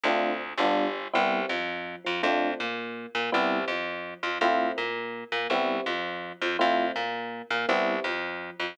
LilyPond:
<<
  \new Staff \with { instrumentName = "Electric Piano 1" } { \time 6/8 \key c \major \tempo 4. = 110 <a c' d' f'>4. <g b d' f'>4. | <g b c' e'>4 f4. f8 | <a c' d' f'>4 ais4. ais8 | <g b c' e'>4 f4. f8 |
<a c' e' f'>4 ais4. ais8 | <g b c' e'>4 f4. f8 | <a c' e' f'>4 ais4. ais8 | <g b c' e'>4 f4. f8 | }
  \new Staff \with { instrumentName = "Electric Bass (finger)" } { \clef bass \time 6/8 \key c \major d,4. g,,4. | c,4 f,4. f,8 | f,4 ais,4. ais,8 | c,4 f,4. f,8 |
f,4 ais,4. ais,8 | c,4 f,4. f,8 | f,4 ais,4. ais,8 | c,4 f,4. f,8 | }
>>